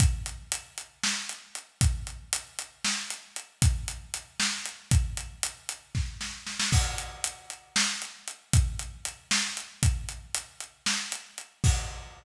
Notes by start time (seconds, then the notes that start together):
0.00 kick, closed hi-hat
0.26 closed hi-hat
0.52 closed hi-hat
0.78 closed hi-hat
1.03 snare
1.29 closed hi-hat
1.55 closed hi-hat
1.81 kick, closed hi-hat
2.07 closed hi-hat
2.33 closed hi-hat
2.59 closed hi-hat
2.84 snare
3.10 closed hi-hat
3.36 closed hi-hat
3.62 kick, closed hi-hat
3.88 closed hi-hat
4.14 closed hi-hat
4.40 snare
4.66 closed hi-hat
4.91 kick, closed hi-hat
5.17 closed hi-hat
5.43 closed hi-hat
5.69 closed hi-hat
5.95 kick, snare
6.21 snare
6.47 snare
6.59 snare
6.72 kick, crash
6.98 closed hi-hat
7.24 closed hi-hat
7.50 closed hi-hat
7.76 snare
8.02 closed hi-hat
8.28 closed hi-hat
8.53 kick, closed hi-hat
8.79 closed hi-hat
9.05 closed hi-hat
9.31 snare
9.57 closed hi-hat
9.83 kick, closed hi-hat
10.09 closed hi-hat
10.34 closed hi-hat
10.60 closed hi-hat
10.86 snare
11.12 closed hi-hat
11.38 closed hi-hat
11.64 kick, crash